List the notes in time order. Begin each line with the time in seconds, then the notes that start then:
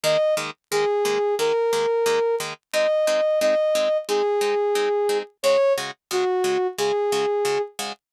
0.04 D#3 G#3 A#3 D#5
0.37 D#3 G#3 A#3
0.71 D#3 G#3 A#3 G#4
1.05 D#3 G#3 A#3
1.39 D#3 G#3 A#3 A#4
1.73 D#3 G#3 A#3
2.06 D#3 G#3 A#3
2.40 D#3 G#3 A#3
2.73 G#3 C4 D#4 D#5
3.07 G#3 C4 D#4
3.41 G#3 C4 D#4 D#5
3.75 G#3 C4 D#4
4.08 G#3 C4 D#4 G#4
4.41 G#3 C4 D#4
4.75 G#3 C4 D#4
5.09 G#3 C4 D#4
5.43 C#3 G#3 F#4 C#5
5.78 C#3 G#3 F#4
6.11 C#3 G#3 F#4
6.44 C#3 G#3 F#4
6.78 C#3 G#3 F#4 G#4
7.12 C#3 G#3 F#4
7.45 C#3 G#3 F#4
7.79 C#3 G#3 F#4